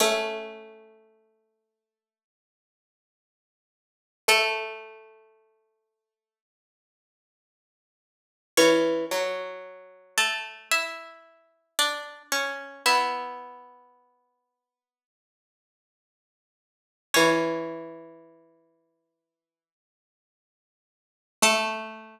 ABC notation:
X:1
M:4/4
L:1/8
Q:1/4=56
K:A
V:1 name="Pizzicato Strings"
[Cc]8 | [A,A]5 z3 | [Cc]3 [A,A] [Ee]2 [Dd] [Cc] | [Ee]8 |
[Cc]8 | A8 |]
V:2 name="Pizzicato Strings"
A,8 | A,8 | E, F,5 z2 | B,8 |
E,6 z2 | A,8 |]